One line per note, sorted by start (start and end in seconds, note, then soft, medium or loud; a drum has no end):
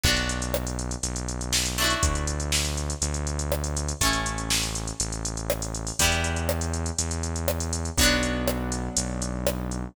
0.04 0.96 B1 loud
0.04 1.68 B3 medium
0.04 1.68 D4 medium
0.04 kick loud
0.04 crash loud
0.08 1.68 F#4 medium
0.17 closed hi-hat medium
0.29 closed hi-hat medium
0.42 closed hi-hat medium
0.54 cross-stick loud
0.67 closed hi-hat medium
0.79 closed hi-hat medium
0.91 closed hi-hat medium
1.03 1.95 B1 medium
1.03 closed hi-hat loud
1.16 closed hi-hat medium
1.29 closed hi-hat medium
1.41 closed hi-hat medium
1.53 snare loud
1.66 closed hi-hat medium
1.78 3.97 A3 medium
1.78 3.97 D4 medium
1.78 closed hi-hat medium
1.82 3.97 E4 medium
1.82 3.97 F#4 medium
1.90 closed hi-hat medium
2.03 2.94 D2 medium
2.03 kick loud
2.03 closed hi-hat loud
2.15 closed hi-hat medium
2.27 closed hi-hat medium
2.40 closed hi-hat medium
2.52 snare loud
2.65 closed hi-hat medium
2.77 closed hi-hat medium
2.90 closed hi-hat medium
3.02 3.93 D2 medium
3.02 closed hi-hat loud
3.14 closed hi-hat medium
3.27 closed hi-hat medium
3.39 closed hi-hat medium
3.52 cross-stick loud
3.64 closed hi-hat medium
3.77 closed hi-hat loud
3.89 closed hi-hat medium
4.01 4.92 A1 medium
4.01 5.96 A3 medium
4.01 5.96 C#4 medium
4.01 kick medium
4.01 closed hi-hat loud
4.05 5.96 E4 medium
4.13 closed hi-hat medium
4.26 closed hi-hat medium
4.38 closed hi-hat medium
4.50 snare loud
4.63 closed hi-hat medium
4.75 closed hi-hat medium
4.88 closed hi-hat medium
5.00 5.92 A1 medium
5.00 closed hi-hat loud
5.13 closed hi-hat medium
5.25 closed hi-hat loud
5.37 closed hi-hat medium
5.50 cross-stick loud
5.62 closed hi-hat medium
5.75 closed hi-hat medium
5.87 open hi-hat medium
5.99 6.91 E2 loud
5.99 7.94 G3 medium
5.99 7.94 B3 medium
5.99 kick loud
5.99 closed hi-hat loud
6.04 7.94 E4 medium
6.12 closed hi-hat medium
6.24 closed hi-hat medium
6.36 closed hi-hat medium
6.49 cross-stick loud
6.61 closed hi-hat medium
6.74 closed hi-hat medium
6.86 closed hi-hat medium
6.99 7.90 E2 medium
6.99 closed hi-hat loud
7.11 closed hi-hat medium
7.23 closed hi-hat medium
7.36 closed hi-hat medium
7.48 cross-stick loud
7.60 closed hi-hat medium
7.73 closed hi-hat loud
7.85 closed hi-hat medium
7.98 8.89 B1 medium
7.98 9.92 F#3 medium
7.98 9.93 F#3 medium
7.98 9.92 B3 medium
7.98 9.93 B3 medium
7.98 9.92 D4 medium
7.98 kick loud
7.98 closed hi-hat loud
8.03 9.93 D4 medium
8.23 closed hi-hat medium
8.48 cross-stick loud
8.72 closed hi-hat medium
8.97 9.88 B1 medium
8.97 closed hi-hat loud
9.22 closed hi-hat medium
9.47 cross-stick loud
9.71 closed hi-hat medium